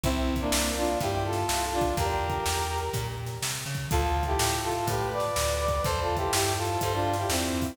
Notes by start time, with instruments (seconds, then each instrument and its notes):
0.04 electric bass (finger) C2, brass section C4 E4, kick, closed hi-hat
0.36 kick, closed hi-hat
0.40 brass section A#3 D4
0.52 electric bass (finger) C2, snare
0.77 brass section D4 F4
0.84 closed hi-hat
1.01 electric bass (finger) G2, brass section E4 G4, kick, closed hi-hat
1.25 brass section F4 A4
1.33 snare, closed hi-hat
1.49 electric bass (finger) C2, snare
1.73 brass section D4 F4
1.81 kick, closed hi-hat
1.97 electric bass (finger) E2, brass section G4 A#4, kick, closed hi-hat
2.30 kick, closed hi-hat
2.46 electric bass (finger) E2, snare
2.78 closed hi-hat
2.93 electric bass (finger) A#2, kick, closed hi-hat
3.26 snare, closed hi-hat
3.42 electric bass (finger) C3, snare
3.66 electric bass (finger) C#3
3.75 kick, closed hi-hat
3.91 electric bass (finger) D2, brass section F4 A4, kick, closed hi-hat
4.23 brass section E4 G4, kick, closed hi-hat
4.39 electric bass (finger) A2, snare
4.64 brass section F4 A4
4.72 closed hi-hat
4.87 electric bass (finger) A2, brass section G4 B4, kick, closed hi-hat
5.12 brass section B4 D5
5.20 snare, closed hi-hat
5.36 electric bass (finger) D2, snare
5.60 brass section B4 D5
5.68 kick, closed hi-hat
5.84 electric bass (finger) E2, brass section A4 C5, kick, closed hi-hat
6.01 brass section F4 A4
6.17 brass section E4 G4, kick, closed hi-hat
6.33 electric bass (finger) G2, brass section E4 G4, snare
6.57 brass section F4 A4
6.65 closed hi-hat
6.81 electric bass (finger) G2, brass section A4 C5, kick, closed hi-hat
6.94 brass section D4 F4
7.13 snare, closed hi-hat
7.18 brass section E4 G4
7.29 electric bass (finger) E2, brass section C4 E4, snare
7.62 kick, open hi-hat